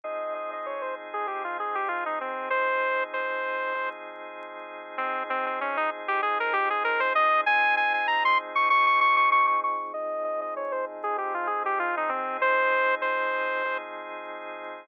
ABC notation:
X:1
M:4/4
L:1/16
Q:"Swing 16ths" 1/4=97
K:Fm
V:1 name="Lead 2 (sawtooth)"
e2 e e d c z A G F A G F E C2 | c4 c6 z6 | C2 C C D E z G A B G A B c e2 | a2 a a b c' z d' d' d' d' d' d' d' d'2 |
e2 e e d c z A G F A G F E C2 | c4 c6 z6 |]
V:2 name="Drawbar Organ"
[F,CEA]8 [F,CEA]8 | [F,CEA]8 [F,CEA]8 | [F,CEA]8 [F,CEA]8 | [F,CEA]8 [F,CEA]8 |
[F,CEA]8 [F,CEA]8 | [F,CEA]8 [F,CEA]8 |]